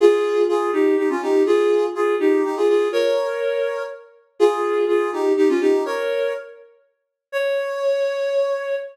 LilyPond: \new Staff { \time 3/4 \key des \lydian \tempo 4 = 123 <f' aes'>4 <f' aes'>8 <ees' g'>8 <ees' g'>16 <des' f'>16 <ees' g'>8 | <f' aes'>4 <f' aes'>8 <ees' g'>8 <ees' g'>16 <f' aes'>16 <f' aes'>8 | <bes' des''>2 r4 | <f' aes'>4 <f' aes'>8 <ees' g'>8 <ees' g'>16 <des' f'>16 <ees' g'>8 |
<bes' des''>4 r2 | des''2. | }